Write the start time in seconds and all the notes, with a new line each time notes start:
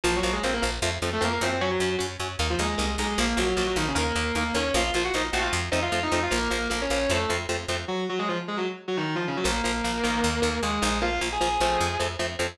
0.04 A#1 F3 A#3 F4
0.16 F#3 F#4
0.23 A#1 F3 A#3
0.32 G#3 G#4
0.43 A#1 F3 A#3 C4 C5
0.53 A#3 A#4
0.62 A#1 F3 A#3
0.82 F2 F3 A3 C4
1.02 F2 F3 A3 C4
1.13 A3 A4
1.21 F2 F3 A3 A#3 C4 A#4
1.32 A#3 A#4
1.41 F#2 F3 A3 C4 C5
1.61 F#3 C#4 F#4
1.71 F#3 F#4
1.80 F#2 F#3 C#4
1.99 F#2 F#3 C#4
2.20 F#2 F#3 C#4
2.39 D#2 A#3 D#4
2.50 F3 F4
2.59 D#2 G#3 A#3 D#4 G#4
2.78 C2 A#3 D#4
2.98 B1 G#3 A#3 D#4 G#4
3.18 A#1 F3 A#3 A#4
3.37 A#1 F3 F#3 A#3 F#4
3.56 A#1 F3 F#3 A#3 F#4
3.66 F#3 F#4
3.76 A#1 D#3 F3 A#3 D#4
3.88 C#3 C#4
3.95 D#2 D#3 A#3 A#4
4.16 D#2 D#3 A#3
4.35 D#2 D#3 A#3 A#4
4.54 D#2 D#3 A#3 C#4 C#5
4.74 A#1 F3 A#3 F4 F5
4.94 A#1 F3 A#3 F4 F5
5.04 F#4 F#5
5.14 A#1 F3 A#3 D#4 D#5
5.32 A#1 F3 A3 C4 F#4 F#5
5.42 F4 F5
5.53 F2
5.71 F2 F3 A3 C4 D#4 D#5
5.82 F4 F5
5.92 F2 F3 A3 C4
6.03 D#4 D#5
6.12 F2 F3 A3 C4 D#4 D#5
6.23 F4 F5
6.31 A#1 F3 A#3 A#4
6.50 A#1 F3 A#3 A#4
6.70 A#1 F3 A#3 A#4
6.81 C#4 C#5
6.90 A#1 F3 A#3
7.09 F2 F3 A3 C4 A4
7.29 F2 F3 A3 C4
7.49 F2 F3 A3 C4
7.68 F2 F3 A3 C4
7.88 F#3 F#4
8.09 F#3 F#4
8.19 G#3 G#4
8.28 F3 F4
8.48 G#3 G#4
8.57 F#3 F#4
8.88 F#3 F#4
8.97 D#3 D#4
9.15 F3 F4
9.27 C#3 C#4
9.37 F#3 F#4
9.44 A#1 F3 A#3 A#4
9.64 A#1 F3 A#3
9.84 A#1 F3 A#3
10.04 A#1 D#3 A#3
10.24 D#2
10.42 D#2 D#3 A#3
10.62 D#2 D#3 G#3 A#3 G#4
10.82 A#1 D#3 A#3
11.02 F3 A#3 F4 F5
11.21 A#1 F3 A#3
11.32 G#4 G#5
11.41 A#1 F3 A#3
11.60 A#1 F3 A3 C4
11.81 F2
12.00 F2 F3 A3 C4
12.19 F2 F3 A3 C4
12.39 F2 F3 A3 C4